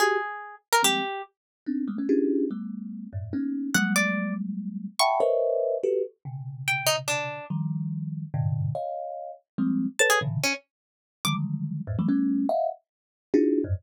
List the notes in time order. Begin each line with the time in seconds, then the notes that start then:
0.00 F#4 G4 G#4
0.73 A#4
0.83 F3 G3 G#3 A#3 C4 G4
1.66 B3 C4 D4 D#4
1.88 G3 G#3 A3 A#3 B3
1.98 A3 B3 C#4
2.09 C#4 D4 E4 F4 G4 G#4
2.51 G3 A3 B3
3.13 F#2 G2 A2
3.33 A#3 B3 C#4 D#4
3.74 F#3 G3 G#3 A#3 F#5
3.96 D5
4.99 E5 F#5 G5 A5 B5 C#6
5.20 A#4 B4 C5 C#5 D#5 E5
5.83 F#4 G4 A4 B4
6.25 B2 C3 C#3
6.68 G5
6.87 D#4
7.08 D4
7.50 D#3 F3 G3
8.34 G2 G#2 A#2 B2 C3 D3
8.75 C#5 D#5 F5
9.58 F3 G3 G#3 A#3 C4
9.99 A4 B4 C#5 A5
10.10 G#4
10.21 A2 A#2 B2 C#3 D3 E3
10.43 C#4
11.25 D3 D#3 F3 F#3 G3 G#3 D6
11.87 E2 F2 F#2 G#2 A2
11.99 E3 F#3 G3 A3
12.09 G3 A3 B3 C#4
12.49 D#5 E5 F5 F#5
13.34 D4 D#4 E4 F4 F#4 G#4
13.64 F2 F#2 G2 G#2